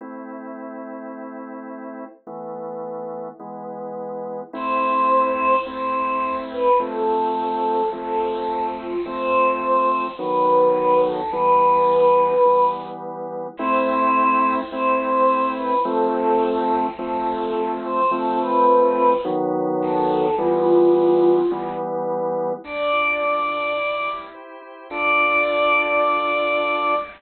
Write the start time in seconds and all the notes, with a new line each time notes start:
0.01 A3 C4 E4
2.27 E3 A3 B3
3.40 E3 G#3 B3
4.53 A3 C4 E4 C5
5.65 A3 C4 E4 C5
6.51 B4
6.79 F3 A3 C4 A4
7.92 F3 A3 C4 A4
8.78 F4
9.05 F3 A3 C4 C5
10.18 D#3 F#3 B3 B4
11.04 A4
11.32 E3 G3 B3 B4
12.45 E3 G3 B3
13.57 A3 C4 E4 C5
14.72 A3 C4 E4 C5
15.56 B4
15.85 F3 A3 C4 A4
16.98 F3 A3 C4 A4
17.84 C5
18.11 F3 A3 C4 A4
18.40 B4
19.25 D#3 F#3 B3
19.82 A4
20.38 E3 G3 B3 F4
21.51 E3 G3 B3
22.64 D4 D5
22.92 F4
23.21 A4
23.49 D4
23.77 E4
24.06 G4
24.34 C5
24.62 E4
24.90 D4 F4 A4 D5